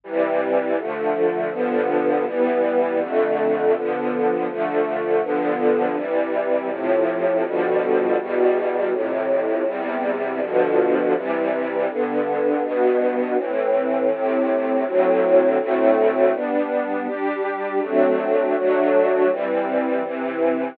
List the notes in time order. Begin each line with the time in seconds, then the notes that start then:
0.04 C3 E3 G3
0.78 D3 F3 A3
1.51 G2 D3 F3 B3
2.26 E3 G3 B3
3.00 F2 D3 A3
3.74 D3 F3 B3
4.48 D3 F3 A3
5.23 G2 D3 F3 B3
5.96 C3 E3 G3
6.70 A2 C3 F3
7.44 B2 D3 F3 G3
8.19 E2 B2 G3
8.92 F2 A2 C3
9.66 E2 C3 G3
10.40 G2 B2 D3 F3
11.15 C3 E3 G3
11.89 G2 D3 B3
12.63 G2 B2 B3
13.37 A2 E3 C4
14.10 A2 C3 C4
14.85 D2 A2 F#3 C4
15.59 D2 A2 A3 C4
16.34 G3 B3 D4
17.07 G3 D4 G4
17.81 F#3 A3 C4 D4
18.55 F#3 A3 D4 F#4
19.30 E3 G3 C4
20.04 C3 E3 C4